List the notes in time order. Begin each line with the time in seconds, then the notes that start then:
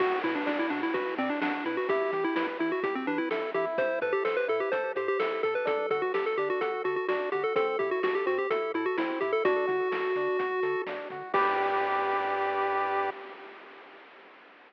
0.00 B1 F#4, kick, crash
0.24 B2 E4 B4, kick, closed hi-hat
0.35 D4
0.46 B1 D4 D5, snare
0.59 E4
0.70 B2 D4 F#4, closed hi-hat
0.83 E4
0.94 B1 F#4 B4, kick, closed hi-hat
1.18 B2 C4 D5, closed hi-hat
1.30 D4
1.41 B1 D4 F#4, snare
1.65 B2 E4 B4, closed hi-hat
1.77 F#4
1.89 E2 E4 G4, kick, closed hi-hat
2.13 E3 G4, kick, closed hi-hat
2.24 E4
2.36 E2 E4 B4, snare
2.59 E3 E4, closed hi-hat
2.72 F#4
2.83 E2 G4, kick, closed hi-hat
2.95 C4
3.07 E3 D4 B4, closed hi-hat
3.18 E4
3.31 E2 E4 A4, snare
3.54 E3 E4 G4, kick, closed hi-hat
3.78 A1 C5, kick, closed hi-hat
4.02 A2 A4 B4, kick, closed hi-hat
4.13 G4
4.24 A1 A4 C5, snare
4.37 B4
4.48 A2 E4 A4, closed hi-hat
4.60 G4
4.72 A1 A4 C5, kick, closed hi-hat
4.96 A2 G4 C5, closed hi-hat
5.08 G4
5.19 A1 E4 A4, snare
5.43 A2 A4, kick, closed hi-hat
5.55 B4
5.65 D2 D4 A4, kick, closed hi-hat
5.90 D3 F#4 A4, kick, closed hi-hat
6.02 F#4
6.14 D2 G4 A4, snare
6.26 A4
6.38 D3 D4 G4, closed hi-hat
6.50 F#4
6.61 D2 F#4 A4, kick, closed hi-hat
6.84 D3 F#4 A4, closed hi-hat
6.96 F#4
7.08 D2 D4 F#4, snare
7.32 D3 F#4 G4, kick, closed hi-hat
7.44 A4
7.55 A1 C4 A4, kick, closed hi-hat
7.79 A2 E4 G4, kick, closed hi-hat
7.91 F#4
8.03 A1 F#4 A4, snare
8.15 G4
8.26 A2 C4 F#4, closed hi-hat
8.38 G4
8.50 A1 E4 A4, kick, closed hi-hat
8.74 A2 E4 A4, closed hi-hat
8.86 F#4
8.98 A1 C4 E4, snare
9.21 A2 E4 G4, kick, closed hi-hat
9.33 A4
9.45 D2 D4 F#4, kick, closed hi-hat
9.67 D3 F#4, kick, closed hi-hat
9.91 D2 A4, snare
10.16 D3 D4, closed hi-hat
10.39 D2 F#4, kick, closed hi-hat
10.63 D3 A4, closed hi-hat
10.86 D2 D4, snare
11.10 D3 F#4, kick, closed hi-hat
11.34 G2 G4 B4 D5, kick, crash